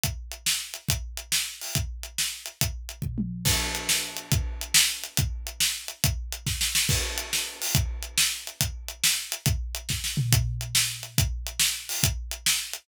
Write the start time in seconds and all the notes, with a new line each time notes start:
0.04 kick, closed hi-hat
0.32 closed hi-hat
0.46 snare
0.74 closed hi-hat
0.89 kick, closed hi-hat
1.17 closed hi-hat
1.32 snare
1.61 open hi-hat
1.75 kick, closed hi-hat
2.03 closed hi-hat
2.18 snare
2.46 closed hi-hat
2.61 kick, closed hi-hat
2.89 closed hi-hat
3.02 kick, floor tom
3.18 mid tom
3.45 kick, crash
3.75 closed hi-hat
3.89 snare
4.17 closed hi-hat
4.32 kick, closed hi-hat
4.61 closed hi-hat
4.74 snare
5.04 closed hi-hat
5.17 kick, closed hi-hat
5.47 closed hi-hat
5.60 snare
5.88 closed hi-hat
6.04 kick, closed hi-hat
6.32 closed hi-hat
6.47 kick, snare
6.61 snare
6.75 snare
6.89 kick, crash
7.18 closed hi-hat
7.33 snare
7.62 open hi-hat
7.75 kick, closed hi-hat
8.03 closed hi-hat
8.18 snare
8.47 closed hi-hat
8.61 kick, closed hi-hat
8.88 closed hi-hat
9.04 snare
9.32 closed hi-hat
9.46 kick, closed hi-hat
9.75 closed hi-hat
9.89 kick, snare
10.04 snare
10.17 floor tom
10.32 kick, closed hi-hat
10.61 closed hi-hat
10.75 snare
11.03 closed hi-hat
11.18 kick, closed hi-hat
11.47 closed hi-hat
11.59 snare
11.89 open hi-hat
12.03 kick, closed hi-hat
12.31 closed hi-hat
12.46 snare
12.73 closed hi-hat